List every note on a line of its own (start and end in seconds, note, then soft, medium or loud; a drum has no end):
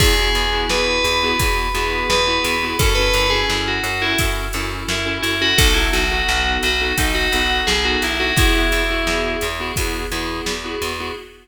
0.00 0.29 E2 loud
0.00 0.14 B3 loud
0.00 0.14 E4 loud
0.00 0.14 F#4 loud
0.00 0.14 G#4 loud
0.00 0.60 G#4 loud
0.00 kick loud
0.00 crash loud
0.18 0.46 B3 medium
0.18 0.46 E4 loud
0.18 0.46 F#4 medium
0.18 0.46 G#4 medium
0.35 0.65 E2 medium
0.35 ride medium
0.52 1.08 B3 medium
0.52 1.08 E4 medium
0.52 1.08 F#4 medium
0.52 1.08 G#4 medium
0.69 0.99 E2 medium
0.69 2.06 B4 loud
0.69 snare loud
1.04 1.34 E2 medium
1.04 ride medium
1.22 1.36 B3 loud
1.22 1.36 E4 loud
1.22 1.36 F#4 medium
1.22 1.36 G#4 loud
1.39 1.69 E2 medium
1.39 1.68 B3 medium
1.39 1.68 E4 medium
1.39 1.68 F#4 medium
1.39 1.68 G#4 medium
1.39 kick medium
1.39 ride medium
1.74 2.04 E2 medium
1.74 2.16 B3 medium
1.74 2.16 E4 medium
1.74 2.16 F#4 medium
1.74 2.16 G#4 loud
1.74 ride medium
2.10 2.39 E2 medium
2.10 2.77 B4 medium
2.10 snare loud
2.26 2.54 B3 loud
2.26 2.54 E4 loud
2.26 2.54 F#4 medium
2.26 2.54 G#4 loud
2.44 2.74 E2 loud
2.44 ride medium
2.62 2.76 B3 medium
2.62 2.76 E4 loud
2.62 2.76 F#4 medium
2.62 2.76 G#4 medium
2.79 3.09 F#2 medium
2.79 2.93 C#4 loud
2.79 2.93 E4 loud
2.79 2.93 F#4 loud
2.79 2.96 A4 loud
2.79 2.93 A4 loud
2.79 kick loud
2.79 ride loud
2.95 3.25 C#4 loud
2.95 3.25 E4 medium
2.95 3.25 F#4 medium
2.95 3.25 A4 loud
2.95 3.28 B4 loud
3.14 3.44 F#2 medium
3.14 ride medium
3.30 3.87 C#4 loud
3.30 3.87 E4 medium
3.30 3.87 F#4 medium
3.30 3.60 G#4 medium
3.30 3.87 A4 medium
3.50 3.79 F#2 medium
3.50 snare medium
3.68 4.02 F#4 medium
3.83 4.13 F#2 medium
3.83 ride medium
4.02 4.16 C#4 medium
4.02 4.16 E4 loud
4.02 4.18 E4 loud
4.02 4.16 F#4 medium
4.02 4.16 A4 medium
4.18 4.49 F#2 medium
4.18 4.46 C#4 medium
4.18 4.46 E4 medium
4.18 4.46 F#4 medium
4.18 4.46 A4 medium
4.18 kick medium
4.18 ride medium
4.53 4.83 F#2 medium
4.53 4.96 C#4 medium
4.53 4.96 E4 medium
4.53 4.96 F#4 medium
4.53 4.96 A4 medium
4.53 ride medium
4.88 5.18 F#2 medium
4.88 5.06 E4 medium
4.88 snare loud
5.05 5.33 C#4 medium
5.05 5.33 E4 medium
5.05 5.33 F#4 medium
5.05 5.33 A4 medium
5.22 5.53 F#2 medium
5.22 5.39 E4 loud
5.22 ride medium
5.40 5.54 C#4 loud
5.40 5.54 E4 medium
5.40 5.54 F#4 medium
5.40 5.58 F#4 loud
5.40 5.54 A4 medium
5.58 5.88 B1 loud
5.58 5.72 B3 loud
5.58 5.72 D#4 loud
5.58 5.72 F#4 loud
5.58 5.74 A4 loud
5.58 5.72 A4 loud
5.58 kick loud
5.58 ride loud
5.74 6.03 B3 medium
5.74 6.03 D#4 medium
5.74 5.91 E4 medium
5.74 6.03 F#4 medium
5.74 6.03 A4 medium
5.93 6.23 B1 medium
5.93 6.51 F#4 loud
5.93 ride medium
6.10 6.66 B3 medium
6.10 6.66 D#4 medium
6.10 6.66 F#4 loud
6.10 6.66 A4 medium
6.28 6.58 B1 medium
6.28 snare medium
6.63 6.93 B1 medium
6.63 6.95 F#4 loud
6.63 ride medium
6.80 6.94 B3 medium
6.80 6.94 D#4 medium
6.80 6.94 F#4 medium
6.80 6.94 A4 medium
6.98 7.27 B1 medium
6.98 7.26 B3 medium
6.98 7.26 D#4 medium
6.98 7.15 D#4 loud
6.98 7.26 F#4 medium
6.98 7.26 A4 medium
6.98 kick medium
6.98 ride loud
7.15 7.57 F#4 loud
7.32 7.62 B1 medium
7.32 7.75 B3 loud
7.32 7.75 D#4 medium
7.32 7.75 F#4 medium
7.32 7.75 A4 medium
7.32 ride medium
7.67 7.97 B1 medium
7.67 7.84 G#4 loud
7.67 snare loud
7.84 8.12 B3 medium
7.84 8.12 D#4 medium
7.84 8.12 F#4 loud
7.84 8.01 F#4 medium
7.84 8.12 A4 medium
8.02 8.32 B1 medium
8.02 8.20 E4 loud
8.02 ride medium
8.19 8.33 B3 medium
8.19 8.33 D#4 medium
8.19 8.33 F#4 medium
8.19 8.36 F#4 loud
8.19 8.33 A4 loud
8.36 8.66 E2 medium
8.36 8.52 B3 loud
8.36 8.52 E4 loud
8.36 9.32 E4 loud
8.36 8.52 F#4 loud
8.36 8.52 G#4 loud
8.36 kick loud
8.36 ride loud
8.54 8.82 B3 medium
8.54 8.82 E4 medium
8.54 8.82 F#4 medium
8.54 8.82 G#4 loud
8.72 9.02 E2 medium
8.72 ride medium
8.90 9.45 B3 medium
8.90 9.45 E4 medium
8.90 9.45 F#4 loud
8.90 9.45 G#4 loud
9.07 9.36 E2 medium
9.07 snare medium
9.41 9.72 E2 medium
9.41 ride medium
9.59 9.73 B3 medium
9.59 9.73 E4 loud
9.59 9.73 F#4 medium
9.59 9.73 G#4 loud
9.76 10.07 E2 medium
9.76 10.05 B3 medium
9.76 10.05 E4 loud
9.76 10.05 F#4 medium
9.76 10.05 G#4 medium
9.76 kick medium
9.76 ride medium
10.11 10.41 E2 medium
10.11 10.53 B3 medium
10.11 10.53 E4 medium
10.11 10.53 F#4 medium
10.11 10.53 G#4 medium
10.11 ride medium
10.46 10.76 E2 medium
10.46 snare loud
10.64 10.92 B3 medium
10.64 10.92 E4 medium
10.64 10.92 F#4 medium
10.64 10.92 G#4 loud
10.82 11.11 E2 medium
10.82 ride medium
10.99 11.13 B3 medium
10.99 11.13 E4 medium
10.99 11.13 F#4 medium
10.99 11.13 G#4 medium